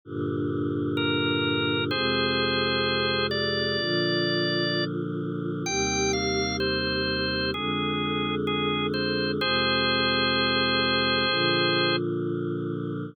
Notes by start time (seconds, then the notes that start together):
0.05 G2 A#2 D3
0.97 A#4
1.91 F2 C3 G#3 G#4 C5
3.31 D5
3.78 A#2 D3 F3
5.66 D#2 C3 G3 G5
6.13 F5
6.60 C5
7.53 F2 D3 G#3 G#4
8.47 G#4
8.94 C5
9.39 F2 C3 G#3 G#4 C5
11.28 A#2 D3 F3